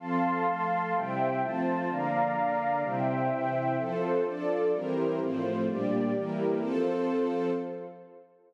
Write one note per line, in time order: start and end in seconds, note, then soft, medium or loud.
0.00 0.46 F3 medium
0.00 0.46 C4 medium
0.00 0.46 A4 medium
0.00 0.94 F5 medium
0.00 0.94 A5 medium
0.00 0.94 C6 medium
0.46 0.93 F3 medium
0.46 0.93 A3 medium
0.46 0.93 A4 medium
0.95 1.41 C3 medium
0.95 1.41 G3 medium
0.95 1.41 E4 medium
0.95 1.41 C5 medium
0.95 1.41 E5 medium
0.95 1.41 G5 loud
1.42 1.89 F3 medium
1.42 1.90 A3 medium
1.42 1.90 C4 medium
1.42 1.89 F4 loud
1.42 1.89 C5 medium
1.42 1.89 A5 medium
1.89 2.35 D3 medium
1.89 2.36 F3 medium
1.89 2.35 A#3 medium
1.89 2.82 D5 medium
1.89 2.82 F5 loud
1.89 2.82 A#5 medium
2.36 2.83 D3 medium
2.36 2.83 A#3 medium
2.36 2.83 D4 medium
2.82 3.29 C3 medium
2.82 3.29 G3 medium
2.82 3.29 E4 medium
2.82 3.77 C5 medium
2.82 3.77 E5 medium
2.82 3.77 G5 medium
3.30 3.77 C3 medium
3.30 3.77 E3 medium
3.30 3.77 E4 medium
3.77 4.24 F3 medium
3.77 4.24 C4 medium
3.77 4.25 F4 loud
3.77 4.24 A4 medium
3.77 4.25 A4 loud
3.77 4.25 C5 loud
4.25 4.72 F3 medium
4.25 4.72 D4 medium
4.25 4.72 F4 medium
4.25 4.72 A4 medium
4.25 4.72 D5 medium
4.73 5.20 E3 medium
4.73 5.20 G3 medium
4.73 5.19 C4 medium
4.73 5.19 E4 loud
4.73 5.19 G4 medium
4.73 5.19 A#4 medium
4.73 5.20 A#4 medium
4.73 5.19 C5 medium
5.20 5.67 A2 medium
5.20 5.67 F3 medium
5.20 5.67 A3 medium
5.20 5.67 C4 medium
5.20 5.67 F4 medium
5.20 5.67 C5 medium
5.67 6.14 A#2 medium
5.67 6.14 G3 medium
5.67 6.14 A#3 medium
5.67 6.14 D4 medium
5.67 6.14 G4 medium
5.67 6.14 D5 medium
6.14 6.61 E3 medium
6.14 6.61 G3 medium
6.14 6.61 A#3 medium
6.14 6.61 E4 medium
6.14 6.61 G4 medium
6.14 6.61 A#4 medium
6.60 7.50 F3 medium
6.60 7.50 C4 loud
6.60 7.52 F4 loud
6.60 7.50 A4 loud
6.60 7.52 A4 loud
6.60 7.52 C5 medium